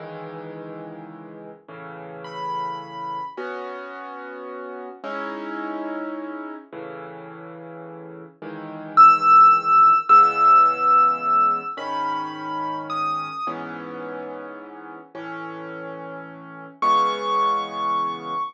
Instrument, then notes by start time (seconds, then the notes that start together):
acoustic grand piano
0.00 C#2 D#3 E3 G#3
1.68 A2 C#3 E3
2.24 B5
3.37 B3 C#4 F#4
5.04 G#3 C#4 D#4 E4
6.73 A2 C#3 E3
8.42 C#2 D#3 E3 G#3
8.97 E6
10.09 C#3 E3 G#3 B3 E6
11.77 G#2 D#3 C#4 B5
12.90 D#6
13.47 G#2 E3 B3 C#4
15.15 A2 E3 C#4
16.82 C#3 E3 G#3 B3 C#6